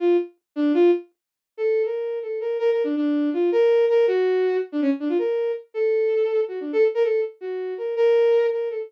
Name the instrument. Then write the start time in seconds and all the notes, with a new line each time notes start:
violin
0.00 F4
0.56 D4
0.74 F4
1.57 A4
1.85 A#4
2.22 A4
2.41 A#4
2.59 A#4
2.72 A#4
2.84 D4
2.96 D4
3.33 F4
3.52 A#4
3.89 A#4
4.07 F#4
4.72 D4
4.82 C#4
5.00 D4
5.09 F4
5.18 A#4
5.74 A4
6.48 F#4
6.60 D4
6.73 A4
6.95 A#4
7.04 A4
7.41 F#4
7.78 A#4
7.96 A#4
8.52 A#4
8.70 A4